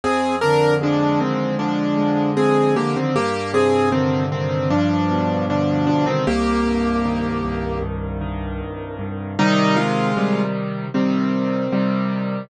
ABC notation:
X:1
M:4/4
L:1/16
Q:1/4=77
K:Cm
V:1 name="Acoustic Grand Piano"
[CA]2 [DB]2 [F,D]2 [E,C]2 [F,D]4 [CA]2 [B,G] [E,C] | [B,G]2 [CA]2 [E,C]2 [E,C]2 [F,D]4 [F,D]2 [F,D] [E,C] | [B,G]8 z8 | [G,E]2 [A,F]4 z2 [E,C]8 |]
V:2 name="Acoustic Grand Piano" clef=bass
F,,2 D,2 A,2 F,,2 D,2 A,2 F,,2 D,2 | G,,2 C,2 D,2 G,,2 G,,2 =B,,2 D,2 G,,2 | C,,2 G,,2 E,2 C,,2 G,,2 E,2 C,,2 G,,2 | [C,E,]4 [C,E,G,]4 [C,G,]4 [C,E,G,]4 |]